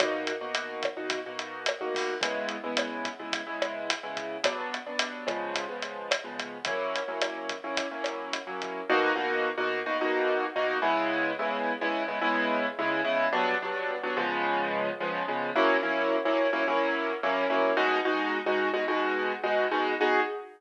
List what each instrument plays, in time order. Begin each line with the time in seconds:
0.00 acoustic grand piano B2 A#3 D#4 F#4, kick, cross-stick, closed hi-hat
0.27 closed hi-hat
0.41 acoustic grand piano B2 A#3 D#4 F#4
0.55 closed hi-hat
0.83 kick, cross-stick, closed hi-hat
0.97 acoustic grand piano B2 A#3 D#4 F#4
1.10 kick, closed hi-hat
1.26 acoustic grand piano B2 A#3 D#4 F#4
1.39 closed hi-hat
1.66 cross-stick, closed hi-hat
1.81 acoustic grand piano B2 A#3 D#4 F#4
1.95 kick, open hi-hat
2.21 acoustic grand piano C#3 G#3 B3 E4, kick, closed hi-hat
2.49 closed hi-hat
2.64 acoustic grand piano C#3 G#3 B3 E4
2.77 cross-stick, closed hi-hat
3.05 kick, closed hi-hat
3.19 acoustic grand piano C#3 G#3 B3 E4
3.32 kick, closed hi-hat
3.47 acoustic grand piano C#3 G#3 B3 E4
3.62 cross-stick, closed hi-hat
3.90 closed hi-hat
4.03 acoustic grand piano C#3 G#3 B3 E4
4.17 kick, closed hi-hat
4.44 acoustic grand piano G2 F#3 B3 D4, kick, cross-stick, closed hi-hat
4.74 closed hi-hat
4.86 acoustic grand piano G2 F#3 B3 D4
4.99 closed hi-hat
5.27 acoustic grand piano C#3 F3 G#3 B3, kick, cross-stick, closed hi-hat
5.54 kick, closed hi-hat
5.69 acoustic grand piano C#3 F3 G#3 B3
5.82 closed hi-hat
6.11 cross-stick, closed hi-hat
6.24 acoustic grand piano C#3 F3 G#3 B3
6.39 kick, closed hi-hat
6.65 acoustic grand piano F#3 A#3 C#4 E4, kick, closed hi-hat
6.95 closed hi-hat
7.08 acoustic grand piano F#3 A#3 C#4 E4
7.21 cross-stick, closed hi-hat
7.49 kick, closed hi-hat
7.64 acoustic grand piano F#3 A#3 C#4 E4
7.77 kick, closed hi-hat
7.91 acoustic grand piano F#3 A#3 C#4 E4
8.04 cross-stick, closed hi-hat
8.33 closed hi-hat
8.47 acoustic grand piano F#3 A#3 C#4 E4
8.62 kick, closed hi-hat
8.89 acoustic grand piano B2 A#3 D#4 F#4
9.16 acoustic grand piano B2 A#3 D#4 F#4
9.58 acoustic grand piano B2 A#3 D#4 F#4
9.86 acoustic grand piano B2 A#3 D#4 F#4
10.01 acoustic grand piano B2 A#3 D#4 F#4
10.56 acoustic grand piano B2 A#3 D#4 F#4
10.82 acoustic grand piano C#3 G#3 B3 E4
11.39 acoustic grand piano C#3 G#3 B3 E4
11.81 acoustic grand piano C#3 G#3 B3 E4
12.08 acoustic grand piano C#3 G#3 B3 E4
12.22 acoustic grand piano C#3 G#3 B3 E4
12.79 acoustic grand piano C#3 G#3 B3 E4
13.05 acoustic grand piano C#3 G#3 B3 E4
13.33 acoustic grand piano G2 F#3 B3 D4
13.62 acoustic grand piano G2 F#3 B3 D4
14.03 acoustic grand piano G2 F#3 B3 D4
14.17 acoustic grand piano C#3 F3 G#3 B3
15.00 acoustic grand piano C#3 F3 G#3 B3
15.28 acoustic grand piano C#3 F3 G#3 B3
15.56 acoustic grand piano F#3 A#3 C#4 E4
15.83 acoustic grand piano F#3 A#3 C#4 E4
16.25 acoustic grand piano F#3 A#3 C#4 E4
16.53 acoustic grand piano F#3 A#3 C#4 E4
16.68 acoustic grand piano F#3 A#3 C#4 E4
17.23 acoustic grand piano F#3 A#3 C#4 E4
17.50 acoustic grand piano F#3 A#3 C#4 E4
17.77 acoustic grand piano B2 G#3 D#4 F#4
18.05 acoustic grand piano B2 G#3 D#4 F#4
18.46 acoustic grand piano B2 G#3 D#4 F#4
18.74 acoustic grand piano B2 G#3 D#4 F#4
18.88 acoustic grand piano B2 G#3 D#4 F#4
19.44 acoustic grand piano B2 G#3 D#4 F#4
19.71 acoustic grand piano B2 G#3 D#4 F#4
20.01 acoustic grand piano B3 D#4 F#4 G#4